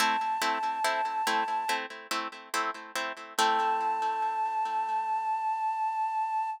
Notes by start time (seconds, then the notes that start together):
0.00 A3 C4 E4 A5
0.42 A3 C4 E4
0.85 A3 C4 E4
1.27 A3 C4 E4
1.69 A3 C4 E4
2.11 A3 C4 E4
2.54 A3 C4 E4
2.95 A3 C4 E4
3.38 A3 C4 E4 A5